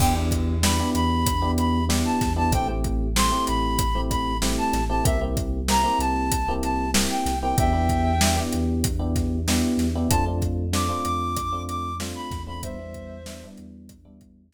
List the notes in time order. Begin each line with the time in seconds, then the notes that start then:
0.00 E2 B3 D4 E4 G4 G5, kick, crash
0.15 B3 D4 E4 G4
0.31 kick, closed hi-hat
0.63 B3 D4 E4 G4 B5, snare
0.79 B3 D4 E4 G4
0.94 E2 B5, closed hi-hat
1.26 kick, closed hi-hat
1.42 B3 D4 E4 G4
1.58 B5, closed hi-hat
1.89 B3 D4 E4 G4, snare
2.05 A5
2.21 E2, kick, snare, closed hi-hat
2.36 B3 D4 E4 G4 A5
2.51 A1 A3 C4 E4 G4 G5, kick, closed hi-hat
2.68 A3 C4 E4 G4
2.84 kick, closed hi-hat
3.16 A3 C4 E4 G4 C6, snare
3.32 A3 C4 E4 G4
3.47 A1 B5, closed hi-hat
3.79 kick, closed hi-hat
3.95 A3 C4 E4 G4
4.10 B5, kick, closed hi-hat
4.42 A3 C4 E4 G4, snare
4.58 A5
4.73 A1, snare, closed hi-hat
4.89 A3 C4 E4 G4 A5
5.05 C2 A#3 C4 E4 G4 E5, kick, closed hi-hat
5.21 A#3 C4 E4 G4
5.37 kick, closed hi-hat
5.68 A#3 C4 E4 G4 A#5, snare
5.84 A#3 C4 E4 G4
5.99 C2 A5, closed hi-hat
6.32 kick, closed hi-hat
6.48 A#3 C4 E4 G4
6.63 A5, closed hi-hat
6.94 A#3 C4 E4 G4, snare
7.10 G5
7.26 C2, snare, closed hi-hat
7.42 A#3 C4 E4 G4 G5
7.58 E2 B3 D4 E4 G4 E5 G5, kick, closed hi-hat
7.73 B3 D4 E4 G4
7.89 kick, closed hi-hat
8.21 B3 D4 E4 G4, snare
8.36 B3 D4 E4 G4
8.53 E2, closed hi-hat
8.84 kick, closed hi-hat
8.99 B3 D4 E4 G4
9.16 kick, snare, closed hi-hat
9.48 B3 D4 E4 G4, snare
9.77 E2, snare, closed hi-hat
9.95 B3 D4 E4 G4
10.09 F2 A3 C4 D4 F4 A5, kick, closed hi-hat
10.26 A3 C4 D4 F4
10.42 kick, closed hi-hat
10.73 A3 C4 D4 F4 D6, snare
10.89 A3 C4 D4 F4
11.05 F2 D6, closed hi-hat
11.37 kick, closed hi-hat
11.53 A3 C4 D4 F4
11.69 D6, closed hi-hat
12.00 A3 C4 D4 F4, snare
12.15 B5
12.31 E2, kick, snare, closed hi-hat
12.47 A3 C4 D4 F4 B5
12.62 G3 B3 D4 E4 C5 E5, kick, closed hi-hat
12.79 G3 B3 D4 E4
12.94 kick, closed hi-hat
13.26 G3 B3 D4 E4, snare
13.43 G3 B3 D4 E4
13.58 E2, closed hi-hat
13.89 kick, closed hi-hat
14.05 G3 B3 D4 E4
14.21 kick, closed hi-hat
14.53 G3 B3 D4 E4, snare